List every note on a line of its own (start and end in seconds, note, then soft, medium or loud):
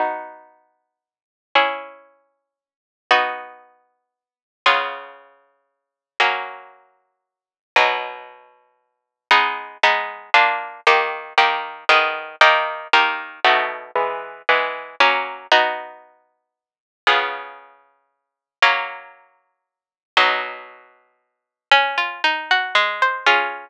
0.00 1.52 B3 medium
0.00 1.52 D#4 medium
0.00 1.52 F#4 medium
1.55 3.07 C#4 medium
1.55 3.07 E4 medium
1.55 3.07 G#4 medium
3.11 4.63 B3 medium
3.11 4.63 D#4 medium
3.11 4.63 F#4 medium
4.66 6.18 C#3 medium
4.66 6.18 B3 medium
4.66 6.18 F4 medium
4.66 6.18 G#4 medium
6.20 7.72 F#3 medium
6.20 7.72 A#3 medium
6.20 7.72 C#4 medium
7.76 9.28 B2 medium
7.76 9.28 F#3 medium
7.76 9.28 D#4 medium
9.31 9.77 G#3 medium
9.31 9.77 B3 medium
9.31 9.77 D#4 medium
9.83 10.30 G#3 medium
9.83 10.30 B3 medium
9.83 10.30 D#4 medium
10.34 10.81 A#3 medium
10.34 10.81 D4 loud
10.34 10.81 F4 medium
10.87 11.33 D#3 medium
10.87 11.33 A#3 medium
10.87 11.33 G4 medium
11.38 11.84 D#3 medium
11.38 11.84 A#3 medium
11.38 11.84 G4 medium
11.89 12.36 D#3 medium
11.89 12.36 B3 medium
11.89 12.36 G#4 medium
12.41 12.88 D#3 medium
12.41 12.88 A#3 medium
12.41 12.88 G4 medium
12.93 13.40 D#3 medium
12.93 13.40 A#3 medium
12.93 13.40 G4 medium
13.45 13.91 B2 medium
13.45 13.91 A3 medium
13.45 13.91 D#4 medium
13.45 13.91 F#4 medium
13.95 14.42 E3 medium
13.95 14.42 G#3 medium
13.95 14.42 B3 medium
14.49 14.95 E3 medium
14.49 14.95 G#3 medium
14.49 14.95 B3 medium
15.00 15.47 F#3 medium
15.00 15.47 A#3 medium
15.00 15.47 C#4 medium
15.52 17.04 B3 medium
15.52 17.04 D#4 medium
15.52 17.04 F#4 medium
17.07 18.59 C#3 medium
17.07 18.59 B3 medium
17.07 18.59 F4 medium
17.07 18.59 G#4 medium
18.62 20.14 F#3 medium
18.62 20.14 A#3 medium
18.62 20.14 C#4 medium
20.17 21.69 B2 medium
20.17 21.69 F#3 medium
20.17 21.69 D#4 medium
21.71 22.21 C#4 loud
21.98 22.22 F4 medium
22.24 22.73 D#4 medium
22.51 22.76 F#4 medium
22.75 23.24 G#3 medium
23.02 23.27 C5 medium
23.26 23.69 C#4 loud
23.26 23.69 F4 loud
23.26 23.69 G#4 loud